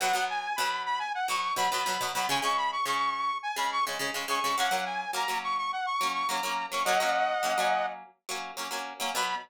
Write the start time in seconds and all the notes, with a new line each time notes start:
0.00 B2 F#3 B3 F#5
0.13 B2 F#3 B3
0.30 G#5
0.56 B2 F#3 B5
0.60 B3
0.85 B5
0.99 G#5
1.14 F#5
1.28 B2 F#3 B3 C#6
1.56 B2 F#3 B3 B5
1.71 B2 F#3 B3 B5
1.86 B2 F#3 B3
2.01 B2 F#3 B3
2.14 B2 F#3 B3 B5
2.29 C#3 G#3 C#4 G#5
2.42 C#3 G#3 C#4 C#6
2.57 B5
2.72 C#6
2.85 C#3 G#3 C#4 C#6
3.42 G#5
3.56 C#3 G#3 C#4 B5
3.72 C#6
3.87 C#3 G#3 C#4
3.99 C#3 G#3 C#4
4.14 C#3 G#3 C#4
4.28 C#3 G#3 C#4 C#6
4.44 C#3 G#3 C#4
4.58 F#3 A#3 C#4 F#5
4.71 F#3 A#3 C#4
4.85 G#5
5.13 F#3 A#3 C#4 A#5
5.28 F#3 A#3 C#4
5.43 C#6
5.58 C#6
5.72 F#5
5.86 C#6
6.01 F#3 A#3 C#4
6.14 C#6
6.28 F#3 A#3 C#4 A#5
6.43 F#3 A#3 C#4
6.72 F#3 A#3 C#4 C#6
6.85 F#3 A#3 C#4 D#5 F#5
7.00 F#3 A#3 C#4
7.43 F#3 A#3 C#4
7.58 F#3 A#3 C#4
8.29 F#3 A#3 C#4
8.57 F#3 A#3 C#4
8.71 F#3 A#3 C#4
9.00 F#3 A#3 C#4
9.15 B2 F#3 B3 B5